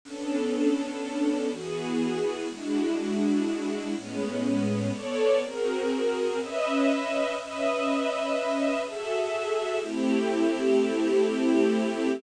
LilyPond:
\new Staff { \time 5/4 \key b \dorian \tempo 4 = 123 <b cis' d' a'>2. <e b fis' gis'>2 | <gis d' e' fis'>2. <a, gis b cis'>2 | <b a' cis'' d''>4 <bis fis' gis' ais'>2 <cis' b' dis'' e''>2 | <cis' b' dis'' e''>2. <fis' gis' a' e''>2 |
\key a \dorian <a c' e' g'>1~ <a c' e' g'>4 | }